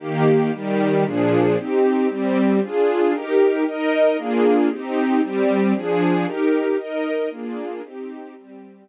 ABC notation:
X:1
M:9/8
L:1/8
Q:3/8=115
K:Eb
V:1 name="String Ensemble 1"
[E,B,G]3 [E,G,G]3 [B,,F,DA]3 | [CEG]3 [G,CG]3 [DFA]3 | [EGB]3 [EBe]3 [B,DFA]3 | [CEG]3 [G,CG]3 [F,DA]3 |
[EGB]3 [EBe]3 [B,DFA]3 | [CEG]3 [G,CG]3 [E,B,G]3 |]